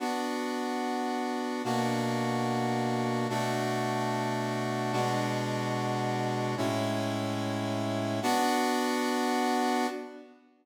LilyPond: \new Staff { \time 6/8 \key b \minor \tempo 4. = 73 <b d' fis'>2. | <b, ais d' fis'>2. | <b, a d' fis'>2. | <b, gis d' fis'>2. |
<a, gis cis' e'>2. | <b d' fis'>2. | }